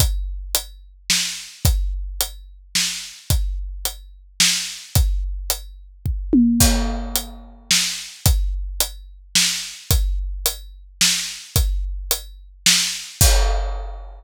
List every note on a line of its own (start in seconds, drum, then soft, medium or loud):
0.00 kick medium
0.00 closed hi-hat medium
0.55 closed hi-hat medium
1.10 snare medium
1.65 kick medium
1.65 closed hi-hat medium
2.21 closed hi-hat medium
2.75 snare medium
3.30 kick medium
3.30 closed hi-hat medium
3.85 closed hi-hat medium
4.40 snare medium
4.95 kick medium
4.95 closed hi-hat medium
5.50 closed hi-hat medium
6.06 kick medium
6.33 high tom medium
6.60 kick medium
6.60 crash medium
7.15 closed hi-hat medium
7.71 snare medium
8.26 kick medium
8.26 closed hi-hat medium
8.80 closed hi-hat medium
9.35 snare medium
9.91 kick medium
9.91 closed hi-hat medium
10.46 closed hi-hat loud
11.01 snare medium
11.56 kick medium
11.56 closed hi-hat medium
12.11 closed hi-hat loud
12.66 snare loud
13.21 kick loud
13.21 crash loud